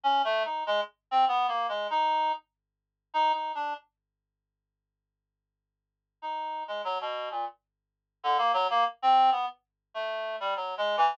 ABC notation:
X:1
M:3/4
L:1/16
Q:1/4=97
K:none
V:1 name="Clarinet"
(3^C2 A,2 ^D2 ^G, z2 =C (3B,2 ^A,2 G,2 | ^D3 z5 (3D2 D2 =D2 | z12 | z4 ^D3 ^G, ^F, B,,2 ^A,, |
z5 D, ^A, ^F, A, z C2 | B, z3 A,3 G, (3^F,2 ^G,2 E,2 |]